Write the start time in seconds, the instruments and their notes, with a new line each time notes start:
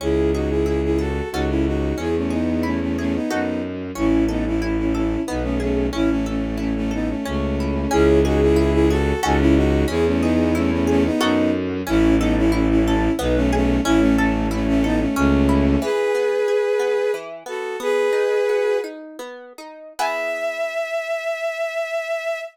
0.00 violin C#2 E4 G#4, orchestral harp C#4
0.34 violin D#4 F#4, orchestral harp G#4
0.49 violin E4 G#4
0.66 violin E4 G#4, orchestral harp E4
0.84 violin E4 G#4
0.98 violin F#4 A4, orchestral harp G#4
1.32 violin C#2 D#4 F#4, orchestral harp C#4 F#4 A4
1.49 violin C#4 E4
1.66 violin D#4 F#4
1.96 violin E2 E4 G#4, orchestral harp C#4
2.16 violin A3 C#4
2.30 violin B3 D#4, orchestral harp G#4
2.63 violin A3 C#4, orchestral harp E4
2.81 violin A3 C#4
2.98 violin A3 C#4, orchestral harp G#4
3.15 violin B3 D#4
3.30 violin F#2 B3 D#4, orchestral harp D#4 F#4 A4
3.95 violin A1 C#4 E4, orchestral harp C#4
4.28 violin B3 D#4, orchestral harp A4
4.46 violin C#4 E4
4.61 violin C#4 E4, orchestral harp E4
4.77 violin C#4 E4
4.94 violin C#4 E4, orchestral harp A4
5.27 violin B1 B3 D#4, orchestral harp B3
5.43 violin A3 C#4
5.60 violin A3 C#4, orchestral harp G#4
5.93 violin A1 C#4 E4, orchestral harp C#4
6.10 violin A3 C#4
6.26 violin A3 C#4, orchestral harp A4
6.58 violin A3 C#4, orchestral harp E4
6.76 violin A3 C#4
6.91 violin B3 D#4, orchestral harp A4
7.09 violin A3 C#4
7.25 violin C#2 A3 C#4, orchestral harp C#4
7.60 orchestral harp E4
7.91 violin C#2 E4 G#4, orchestral harp C#4
8.25 violin D#4 F#4, orchestral harp G#4
8.41 violin E4 G#4
8.56 orchestral harp E4, violin E4 G#4
8.73 violin E4 G#4
8.90 violin F#4 A4, orchestral harp G#4
9.23 violin C#2 D#4 F#4, orchestral harp C#4 F#4 A4
9.40 violin C#4 E4
9.56 violin D#4 F#4
9.88 violin E2 E4 G#4, orchestral harp C#4
10.06 violin A3 C#4
10.21 violin B3 D#4, orchestral harp G#4
10.55 violin A3 C#4, orchestral harp E4
10.71 violin A3 C#4
10.87 violin A3 C#4, orchestral harp G#4
11.05 violin B3 D#4
11.20 violin F#2 B3 D#4, orchestral harp D#4 F#4 A4
11.87 violin A1 C#4 E4, orchestral harp C#4
12.19 violin B3 D#4, orchestral harp A4
12.37 violin C#4 E4
12.52 violin C#4 E4, orchestral harp E4
12.70 violin C#4 E4
12.85 violin C#4 E4, orchestral harp A4
13.18 violin B1 B3 D#4, orchestral harp B3
13.35 violin A3 C#4
13.52 violin A3 C#4, orchestral harp G#4
13.85 violin A1 C#4 E4, orchestral harp C#4
14.00 violin A3 C#4
14.17 violin A3 C#4, orchestral harp A4
14.51 violin A3 C#4, orchestral harp E4
14.67 violin A3 C#4
14.84 violin B3 D#4, orchestral harp A4
15.00 violin A3 C#4
15.16 violin C#2 A3 C#4, orchestral harp C#4
15.49 orchestral harp E4
15.82 orchestral harp E3, violin G#4 B4
16.15 orchestral harp B3
16.48 orchestral harp G#4
16.79 orchestral harp B3
17.14 orchestral harp E3
17.46 orchestral harp B3, violin F#4 A4
17.80 orchestral harp B3, violin G#4 B4
18.13 orchestral harp D#4
18.49 orchestral harp F#4
18.84 orchestral harp D#4
19.19 orchestral harp B3
19.58 orchestral harp D#4
19.99 orchestral harp B3 E4 G#4, violin E5